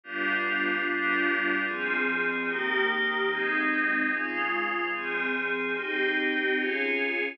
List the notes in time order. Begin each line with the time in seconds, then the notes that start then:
0.04 G3 B3 D4 F4
0.85 G3 B3 D4 F4
1.67 F3 C4 G#4
2.49 D#3 A#3 G4
3.30 G#3 C4 D#4
4.12 C#3 G#3 F4
4.93 F3 C4 G#4
5.75 C4 D#4 G4
6.57 C#4 F4 G#4